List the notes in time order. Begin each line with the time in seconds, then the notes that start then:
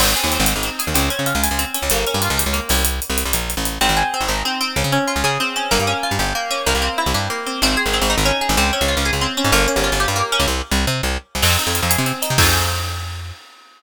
0.00 G#1 C4, crash
0.16 G#4, closed hi-hat
0.24 D#2
0.32 C4, closed hi-hat
0.40 G#1
0.46 D#4, closed hi-hat
0.56 G#1
0.63 C4, closed hi-hat
0.79 G#4, closed hi-hat
0.87 D#2
0.94 C#2 C4, closed hi-hat
1.10 C#4, closed hi-hat
1.19 C#3
1.26 F4, closed hi-hat
1.35 C#2
1.43 G#4, closed hi-hat
1.51 C#2
1.59 C4, closed hi-hat
1.74 C#4, closed hi-hat
1.82 C#2
1.90 G1 A#3, closed hi-hat
2.07 C#4, closed hi-hat
2.14 G2
2.22 F4, closed hi-hat
2.30 C#2
2.37 G4, closed hi-hat
2.46 C#2
2.53 A#3, closed hi-hat
2.69 C2 C#4, open hi-hat
2.85 closed hi-hat
3.02 closed hi-hat
3.10 C2
3.18 closed hi-hat
3.25 C2
3.33 A#1, closed hi-hat
3.50 closed hi-hat
3.57 A1
3.65 closed hi-hat
3.81 G#1 C4
3.89 G#1
3.97 G#4
4.14 C4
4.21 G#1
4.28 G#1 D#4
4.45 C4
4.61 C4
4.76 C#2
4.84 C#3
4.92 C#4
5.08 F4
5.16 C#2
5.24 C#3 G#4
5.40 C4
5.56 C#4
5.71 G1 A#3
5.79 G2
5.87 C#4
6.03 F4
6.11 G2
6.19 G1 G4
6.35 A#3
6.51 C#4
6.66 C2 A#3
6.75 C2
6.82 C4
6.98 E4
7.06 C2
7.14 G2 G4
7.30 A#3
7.46 C4
7.62 G#1 C4
7.77 G#4
7.86 G#1
7.93 C4
8.01 G#1
8.10 D#4
8.18 G#1
8.25 C#4
8.41 G#4
8.49 G#1
8.57 C#2 C4
8.73 C#4
8.81 C#2
8.88 F4
8.97 C#2
9.05 G#4
9.13 C#2
9.21 C4
9.37 C#4
9.44 G#2
9.52 G1 A#3
9.68 C#4
9.76 G1
9.84 F4
9.92 G1
10.00 G4
10.08 G2
10.16 A#3
10.32 C#4
10.40 C#2
10.48 C2
10.71 C2
10.87 C3
11.03 C2
11.35 C2
11.42 F2 C4, crash
11.58 D#4, closed hi-hat
11.67 F2
11.75 F4, closed hi-hat
11.83 F2
11.90 G#4, closed hi-hat
11.98 C3
12.06 C4, closed hi-hat
12.22 D#4, closed hi-hat
12.30 C3
12.38 F2 C4 D#4 F4 G#4, kick, crash